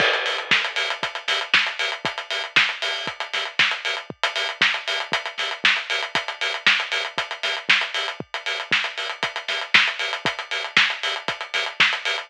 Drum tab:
CC |x---------------|----------------|----------------|----------------|
HH |-xox-xoxxxox-xox|xxox-xo-xxox-xox|-xox-xoxxxox-xox|xxox-xoxxxox-xox|
SD |----o-----o-o---|----o-----o-o---|----o-----o-o---|----o-----o-o---|
BD |o---o---o---o---|o---o---o---o---|o---o---o---o---|o---o---o---o---|

CC |----------------|----------------|
HH |-xox-xoxxxox-xox|xxox-xoxxxox-xox|
SD |----o-----o-o---|----o-----o-o---|
BD |o---o---o---o---|o---o---o---o---|